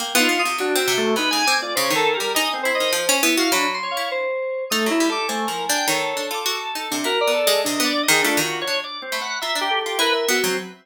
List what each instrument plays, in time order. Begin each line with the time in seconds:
0.00 harpsichord A#3, electric piano 2 G5
0.15 harpsichord B3, drawbar organ F4
0.19 electric piano 2 D#4
0.29 harpsichord B3
0.39 electric piano 2 D#6
0.45 harpsichord C3
0.58 harpsichord F#3, drawbar organ D4, electric piano 2 F#4
0.75 harpsichord C4, drawbar organ E5
0.88 harpsichord C3
0.98 drawbar organ A3
1.16 harpsichord C3, electric piano 2 D#4, drawbar organ B4
1.31 harpsichord C#3, drawbar organ G#5
1.47 harpsichord C4, electric piano 2 D6
1.62 electric piano 2 F4, drawbar organ D5
1.75 harpsichord C#3, electric piano 2 C5, drawbar organ C#5
1.90 harpsichord D#3
1.95 drawbar organ A4, electric piano 2 A#4
2.14 electric piano 2 G4, drawbar organ A#4
2.20 harpsichord G3
2.35 harpsichord D#4, drawbar organ D#5, electric piano 2 G#5
2.54 drawbar organ C4
2.63 harpsichord E4, electric piano 2 C5
2.75 drawbar organ D#5
2.80 harpsichord D#3
2.93 harpsichord F3
3.09 harpsichord C#4
3.22 harpsichord B3, electric piano 2 E4
3.37 harpsichord F#4, drawbar organ F5
3.52 harpsichord F#3, drawbar organ D4, electric piano 2 B5
3.74 electric piano 2 C6
3.83 drawbar organ C#5
3.91 electric piano 2 F5
3.97 harpsichord E4
4.11 electric piano 2 C5
4.70 drawbar organ A3, harpsichord D#4, electric piano 2 D#6
4.86 harpsichord F#3, electric piano 2 E4
4.91 drawbar organ E4
5.00 harpsichord G3
5.10 drawbar organ A4, electric piano 2 D6
5.28 drawbar organ A3, harpsichord C4, electric piano 2 G#5
5.47 harpsichord F3, drawbar organ A#4
5.69 harpsichord D4, drawbar organ G5
5.87 harpsichord D#3, drawbar organ A4, electric piano 2 C#5
6.17 harpsichord D4
6.31 harpsichord F4, electric piano 2 D6
6.46 harpsichord F#4
6.75 harpsichord D#4
6.91 harpsichord C3, electric piano 2 D4
7.04 harpsichord E4, electric piano 2 F#4, drawbar organ A#4
7.21 electric piano 2 D5
7.27 harpsichord B3
7.34 drawbar organ A4
7.47 harpsichord G#3
7.64 harpsichord C3, electric piano 2 D4, drawbar organ D#5
7.80 harpsichord B3
7.84 drawbar organ D5
8.03 drawbar organ D#5
8.08 harpsichord D#3, electric piano 2 G#4
8.22 harpsichord A3, drawbar organ D4, electric piano 2 F4
8.37 harpsichord D#3
8.41 drawbar organ F#4
8.62 drawbar organ C#5
8.67 harpsichord D4
8.84 drawbar organ D5
9.02 drawbar organ C4
9.12 harpsichord A3, electric piano 2 B5
9.21 drawbar organ F#5
9.42 harpsichord F4, drawbar organ E5, electric piano 2 A#5
9.55 harpsichord D4
9.61 drawbar organ G4
9.70 electric piano 2 A4
9.81 drawbar organ G4
9.86 harpsichord F4
9.99 harpsichord E4, electric piano 2 A#4, drawbar organ B4
10.13 drawbar organ E5
10.29 harpsichord B3, electric piano 2 F#4
10.44 harpsichord F#3, drawbar organ C4